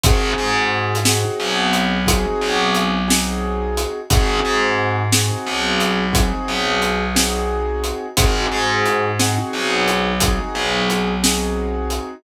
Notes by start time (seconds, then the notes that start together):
0.03 G#1 C4 D#4 F#4 G#4, kick, closed hi-hat
0.38 G#2
0.95 closed hi-hat
1.05 C4 D#4 F#4 G#4, snare
1.40 B1
1.73 closed hi-hat
2.06 C4 D#4 F#4 G#4, kick, closed hi-hat
2.41 B1
2.75 closed hi-hat
3.08 C4 D#4 F#4 G#4, snare
3.77 closed hi-hat
4.10 G#1 C4 D#4 F#4 G#4, kick, closed hi-hat
4.45 G#2
5.12 C4 D#4 F#4 G#4, snare
5.46 B1
5.80 closed hi-hat
6.13 C4 D#4 F#4 G#4, kick, closed hi-hat
6.48 B1
6.82 closed hi-hat
7.15 C4 D#4 F#4 G#4, snare
7.84 closed hi-hat
8.17 G#1 C4 D#4 F#4 G#4, kick, closed hi-hat
8.52 G#2
8.85 closed hi-hat
9.19 C4 D#4 F#4 G#4, snare
9.53 B1
9.88 closed hi-hat
10.20 C4 D#4 F#4 G#4, kick, closed hi-hat
10.55 B1
10.90 closed hi-hat
11.23 C4 D#4 F#4 G#4, snare
11.90 closed hi-hat